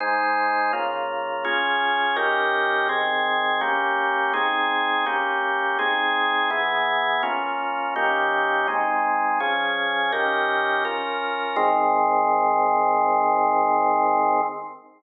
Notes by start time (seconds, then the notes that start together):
0.00 G#3 D#4 C5
0.73 C#3 A#3 F4
1.44 C#4 F4 G#4
2.16 D#3 C#4 G4 A#4
2.89 D#3 C4 G#4
3.61 A#3 C#4 G4
4.33 C4 D#4 G#4
5.06 A#3 C#4 G4
5.79 C4 D#4 G#4
6.50 E3 B3 G#4
7.23 A#3 C#4 F4
7.96 D#3 A#3 C#4 G4
8.68 G#3 C4 D#4
9.40 F3 C#4 G#4
10.12 D#3 C#4 G4 A#4
10.85 C#4 F4 A#4
11.56 G#2 D#3 C4